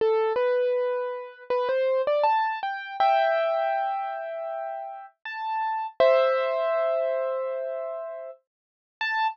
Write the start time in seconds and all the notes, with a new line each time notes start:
0.01 A4
0.36 B4
1.50 B4
1.69 C5
2.07 D5
2.23 A5
2.63 G5
3.00 E5 G5
5.25 A5
6.00 C5 E5
9.01 A5